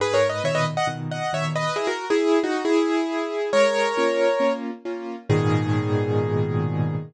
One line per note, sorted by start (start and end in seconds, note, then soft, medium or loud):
0.00 0.40 G#2 medium
0.00 0.15 G#4 loud
0.00 0.15 B4 loud
0.14 0.28 A#4 medium
0.14 0.28 C#5 loud
0.29 0.43 B4 medium
0.29 0.43 D#5 medium
0.44 0.75 A#2 medium
0.44 0.75 B2 medium
0.44 0.75 D#3 medium
0.44 0.55 C#5 loud
0.44 0.55 E5 loud
0.55 0.65 B4 medium
0.55 0.65 D#5 loud
0.77 0.87 D#5 medium
0.77 0.87 F#5 loud
0.87 1.18 A#2 medium
0.87 1.18 B2 medium
0.87 1.18 D#3 medium
1.11 1.32 D#5 medium
1.11 1.32 F#5 medium
1.33 1.64 A#2 soft
1.33 1.64 B2 medium
1.33 1.64 D#3 medium
1.33 1.44 C#5 loud
1.33 1.44 E5 loud
1.56 1.76 B4 loud
1.56 1.76 D#5 loud
1.76 1.86 E4 loud
1.76 1.86 G#4 loud
1.87 2.05 F#4 medium
1.87 2.05 A#4 loud
2.10 2.39 E4 loud
2.10 2.39 G#4 loud
2.43 2.63 D#4 medium
2.43 2.63 F#4 loud
2.65 3.50 E4 loud
2.65 3.50 G#4 loud
3.53 3.93 G#3 medium
3.53 4.53 A#4 loud
3.53 4.53 C#5 loud
3.97 4.28 A#3 medium
3.97 4.28 C#4 medium
3.97 4.28 F4 medium
4.40 4.71 A#3 medium
4.40 4.71 C#4 medium
4.40 4.71 F4 medium
4.85 5.16 A#3 medium
4.85 5.16 C#4 medium
4.85 5.16 F4 medium
5.29 6.95 G#2 loud
5.29 6.95 A#2 loud
5.29 6.95 B2 loud
5.29 6.95 D#3 loud
5.29 6.95 G#4 loud